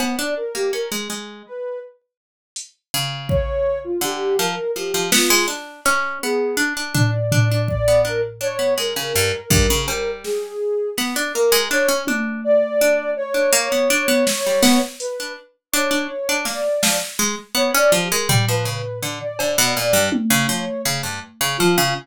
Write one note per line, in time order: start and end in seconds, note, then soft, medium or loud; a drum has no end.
0.00 0.16 B3 medium
0.00 cowbell loud
0.18 0.35 D4 medium
0.18 0.34 D5 medium
0.37 0.53 A#4 medium
0.55 0.71 A#3 medium
0.55 0.71 G4 medium
0.73 0.89 C#4 medium
0.73 0.90 A#4 medium
0.92 1.08 G#3 medium
1.10 1.43 G#3 medium
1.46 1.79 B4 medium
2.56 closed hi-hat medium
2.94 3.93 C#3 medium
3.29 3.79 C#5 loud
3.29 kick medium
3.84 4.01 F4 medium
4.01 4.34 D3 medium
4.01 4.36 G4 loud
4.38 4.55 F3 medium
4.38 4.71 A#4 medium
4.75 4.92 F3 medium
4.75 5.08 G4 medium
4.94 5.11 F3 medium
5.12 5.29 B3 loud
5.12 5.46 F4 medium
5.12 snare loud
5.30 5.47 G#3 loud
5.48 5.81 D4 medium
5.85 6.19 C#4 loud
5.85 clap medium
6.22 6.56 B3 medium
6.22 6.55 G#4 medium
6.57 6.73 D4 medium
6.77 6.93 D4 medium
6.95 7.11 D4 medium
6.95 7.61 D5 medium
6.95 floor tom loud
7.32 7.49 D4 medium
7.32 floor tom loud
7.52 7.68 D4 medium
7.68 8.01 D5 loud
7.68 kick medium
7.88 8.04 B3 medium
8.05 8.21 D4 medium
8.05 8.22 A#4 loud
8.41 8.57 D4 medium
8.41 8.74 C#5 loud
8.59 8.75 B3 medium
8.78 8.94 G#3 medium
8.78 10.11 A#4 medium
8.96 9.13 C#3 medium
9.15 9.32 G2 medium
9.15 cowbell medium
9.50 9.67 G2 loud
9.50 kick loud
9.70 9.87 C#3 loud
9.88 10.54 G3 medium
9.88 cowbell loud
10.24 10.90 G#4 medium
10.24 snare medium
10.98 11.14 B3 medium
10.98 snare medium
11.16 11.32 D4 medium
11.34 11.52 A#3 medium
11.34 11.67 A#4 loud
11.52 11.68 G#3 loud
11.70 11.87 D4 medium
11.70 12.03 C#5 loud
11.70 clap medium
11.89 12.05 C#4 medium
12.07 12.41 D4 medium
12.07 high tom medium
12.44 13.10 D5 loud
12.81 13.14 D4 medium
13.16 14.81 C#5 loud
13.34 13.51 D4 medium
13.53 13.69 A#3 loud
13.72 13.88 B3 medium
13.90 14.07 D4 loud
14.08 14.25 B3 loud
14.27 snare loud
14.46 14.63 G3 medium
14.62 14.79 B3 loud
14.62 snare medium
15.00 15.33 B4 medium
15.00 closed hi-hat medium
15.20 15.36 D4 medium
15.72 15.90 D4 loud
15.72 16.38 C#5 medium
15.91 16.07 D4 medium
16.29 16.45 D4 medium
16.45 16.62 A#3 medium
16.45 16.97 D5 medium
16.45 snare medium
16.83 16.99 F3 medium
16.83 snare loud
17.19 17.36 G#3 loud
17.55 17.71 B3 medium
17.55 17.72 C#5 loud
17.74 17.91 C#4 loud
17.74 17.92 D5 loud
17.92 18.09 F3 loud
17.92 18.09 G4 medium
18.11 18.28 G#3 loud
18.11 18.27 A#4 medium
18.29 18.46 G3 loud
18.29 floor tom loud
18.48 18.65 F3 medium
18.48 18.65 B4 loud
18.65 18.82 C#3 medium
18.65 18.99 B4 medium
19.03 19.19 D3 medium
19.20 19.37 D5 medium
19.38 19.56 D3 medium
19.38 19.71 D5 medium
19.38 cowbell loud
19.58 19.75 B2 loud
19.76 19.93 A#2 medium
19.76 20.09 D5 medium
19.93 20.10 G2 medium
20.12 high tom loud
20.30 20.47 C#3 loud
20.49 20.65 F3 medium
20.49 20.82 C#5 medium
20.85 21.02 C#3 medium
21.03 21.20 G2 soft
21.41 21.57 C#3 loud
21.58 21.77 F3 medium
21.58 21.91 F4 loud
21.78 21.94 C#3 loud